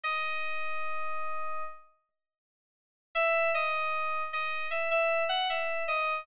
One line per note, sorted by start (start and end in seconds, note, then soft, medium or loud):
0.03 1.62 D#5 medium
3.15 3.50 E5 loud
3.54 4.22 D#5 medium
4.33 4.66 D#5 medium
4.71 4.89 E5 medium
4.91 5.24 E5 medium
5.29 5.47 F#5 medium
5.50 5.83 E5 medium
5.88 6.19 D#5 medium